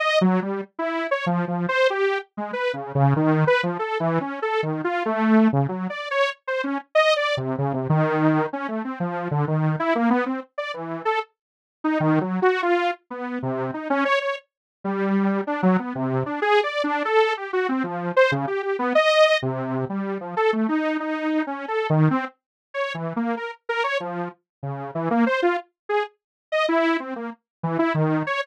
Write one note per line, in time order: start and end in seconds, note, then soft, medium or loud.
0.00 0.19 D#5 loud
0.21 0.40 F#3 medium
0.42 0.61 G3 medium
0.79 1.07 E4 medium
1.11 1.25 C#5 medium
1.26 1.45 F3 medium
1.48 1.66 F3 medium
1.69 1.88 C5 loud
1.90 2.19 G4 medium
2.37 2.51 G#3 medium
2.53 2.72 B4 medium
2.73 2.92 C#3 medium
2.95 3.14 C#3 loud
3.16 3.45 D#3 loud
3.47 3.61 B4 loud
3.63 3.78 F3 medium
3.79 3.98 A4 medium
4.00 4.19 E3 loud
4.21 4.40 C#4 medium
4.42 4.61 A4 medium
4.63 4.82 D#3 medium
4.84 5.03 F4 medium
5.06 5.48 A3 medium
5.53 5.67 C#3 medium
5.69 5.88 F#3 medium
5.90 6.09 D5 medium
6.11 6.30 C#5 loud
6.48 6.62 C5 medium
6.64 6.78 C#4 medium
6.95 7.14 D#5 loud
7.16 7.35 D5 medium
7.37 7.56 C3 medium
7.58 7.73 C#3 medium
7.73 7.88 C3 medium
7.90 8.46 D#3 loud
8.53 8.67 C#4 medium
8.68 8.83 A3 medium
8.85 8.99 C4 medium
9.00 9.28 F3 medium
9.31 9.45 D3 medium
9.48 9.76 D#3 medium
9.79 9.94 E4 loud
9.95 10.09 A#3 medium
10.10 10.24 B3 loud
10.26 10.40 C4 medium
10.58 10.72 D5 medium
10.74 11.02 E3 medium
11.05 11.19 A4 medium
11.84 11.98 D#4 medium
12.00 12.19 D#3 loud
12.21 12.40 F#3 medium
12.42 12.61 F#4 loud
12.63 12.91 F4 medium
13.10 13.39 B3 medium
13.43 13.71 C3 medium
13.74 13.88 D#4 soft
13.90 14.04 C#4 loud
14.05 14.19 C#5 loud
14.21 14.36 C#5 medium
14.84 15.41 G3 medium
15.47 15.61 D4 medium
15.63 15.77 F#3 loud
15.79 15.93 B3 medium
15.95 16.24 C3 medium
16.26 16.40 D4 medium
16.42 16.61 G#4 loud
16.63 16.82 D5 medium
16.84 17.03 D4 loud
17.05 17.34 A4 loud
17.37 17.51 G4 medium
17.53 17.67 F#4 medium
17.69 17.83 C4 medium
17.84 18.12 F3 medium
18.16 18.31 C5 loud
18.32 18.46 C#3 medium
18.47 18.62 G4 medium
18.63 18.77 G4 medium
18.79 18.93 B3 loud
18.95 19.38 D#5 loud
19.42 19.85 C3 medium
19.89 20.18 G3 medium
20.21 20.35 F3 medium
20.37 20.51 A4 medium
20.53 20.67 A3 medium
20.69 20.97 D#4 medium
21.00 21.43 D#4 medium
21.47 21.66 C#4 medium
21.68 21.87 A4 medium
21.90 22.09 D#3 loud
22.11 22.25 C4 loud
22.74 22.93 C#5 medium
22.94 23.13 E3 medium
23.16 23.35 A#3 medium
23.37 23.51 A#4 medium
23.69 23.83 A#4 loud
23.84 23.98 C#5 medium
24.00 24.29 F3 medium
24.63 24.91 C#3 medium
24.95 25.09 E3 medium
25.11 25.25 A#3 loud
25.26 25.41 C5 medium
25.42 25.57 F4 medium
25.89 26.03 G#4 medium
26.52 26.66 D#5 medium
26.69 26.97 E4 loud
27.00 27.14 C4 medium
27.16 27.30 A#3 medium
27.63 27.78 E3 medium
27.79 27.93 E4 loud
27.94 28.23 D#3 medium
28.27 28.41 C#5 medium